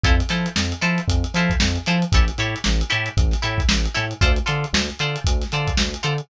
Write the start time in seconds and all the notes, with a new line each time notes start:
0.03 F2 E4 F4 A4 C5, kick, closed hi-hat
0.20 closed hi-hat
0.29 F3 E4 F4 A4 C5, snare, closed hi-hat
0.46 closed hi-hat
0.56 F2, snare
0.72 closed hi-hat
0.81 F3 E4 F4 A4 C5, snare, closed hi-hat
0.98 closed hi-hat
1.08 F2, kick, closed hi-hat
1.24 closed hi-hat
1.34 F3 E4 F4 A4 C5, snare, closed hi-hat
1.50 kick, closed hi-hat
1.60 F2, snare
1.76 closed hi-hat
1.86 F3 E4 F4 A4 C5, closed hi-hat
2.02 closed hi-hat
2.12 A1 E4 G4 A4 C#5, kick, closed hi-hat
2.28 closed hi-hat
2.38 A2 E4 G4 A4 C#5, closed hi-hat
2.56 closed hi-hat
2.64 A1, snare
2.81 closed hi-hat
2.90 A2 E4 G4 A4 C#5, closed hi-hat
3.06 closed hi-hat
3.17 A1, kick, closed hi-hat
3.31 snare, closed hi-hat
3.42 A2 E4 G4 A4 C#5, closed hi-hat
3.58 kick, closed hi-hat
3.69 A1, snare
3.85 closed hi-hat
3.94 A2 E4 G4 A4 C#5, snare, closed hi-hat
4.11 closed hi-hat
4.21 D2 F4 A4 C5 D5, kick, closed hi-hat
4.36 closed hi-hat
4.46 D3 F4 A4 C5 D5, closed hi-hat
4.64 closed hi-hat
4.73 D2, snare
4.90 closed hi-hat
4.99 D3 F4 A4 C5 D5, closed hi-hat
5.16 closed hi-hat
5.24 D2, kick, closed hi-hat
5.42 snare, closed hi-hat
5.52 D3 F4 A4 C5 D5, closed hi-hat
5.67 kick, closed hi-hat
5.77 D2, snare
5.94 closed hi-hat
6.03 D3 F4 A4 C5 D5, closed hi-hat
6.18 closed hi-hat